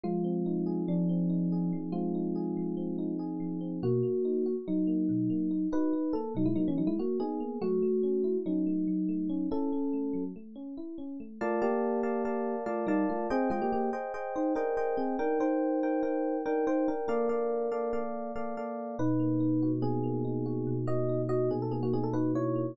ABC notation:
X:1
M:9/8
L:1/16
Q:3/8=95
K:Bbmix
V:1 name="Electric Piano 1"
[A,F]8 [F,D]10 | [A,F]14 z4 | [K:Bmix] [^A,F]8 [F,D]10 | [DB]4 A2 [F,D] [G,E] [F,D] [E,C] [F,D] [G,E] [^A,F]2 [B,G]4 |
[A,F]8 [F,D]10 | [CA]8 z10 | [K:Bbmix] [=A,F]2 [B,G]10 [A,F]2 [G,E]2 [A,F]2 | [CA]2 [A,F] [B,G] [B,G]2 z4 [Ec]2 [DB]4 [CA]2 |
[DB]2 [Ec]10 [DB]2 [Ec]2 [DB]2 | [DB]10 z8 | [K:Bmix] [DB]8 [B,G]10 | [Fd]4 [Fd]2 [B,G] A [B,G] [^A,F] [B,G] =A [DB]2 [Ec]4 |]
V:2 name="Electric Piano 1"
F,2 C2 E2 A2 z2 C2 E2 A2 F,2 | C2 E2 A2 F,2 C2 E2 A2 F,2 C2 | [K:Bmix] B,,2 ^A,2 D2 F2 z2 A,2 B,,2 A,2 D2 | F2 D2 ^A,2 B,,2 A,2 z4 D2 A,2 |
F,2 A,2 C2 E2 C2 A,2 F,2 A,2 C2 | E2 C2 A,2 F,2 A,2 C2 E2 C2 A,2 | [K:Bbmix] [Bdf=a]2 [Bdfa]4 [Bdfa]2 [Bdfa]4 [Bdfa]2 [Bdfa]4 | [Aceg]2 [Aceg]4 [Aceg]2 [Aceg]4 [Aceg]2 [Aceg]4 |
[Eg]2 [Bg]4 [EBg]2 [EBg]4 [Eg]2 [Bg]4 | [B,=Adf]2 [B,Adf]4 [B,Adf]2 [B,Adf]4 [B,Adf]2 [B,Adf]4 | [K:Bmix] B,,2 ^A,2 D2 F2 B,,2 A,2 D2 F2 B,,2 | ^A,2 D2 z2 B,,2 A,2 D2 F2 B,,2 A,2 |]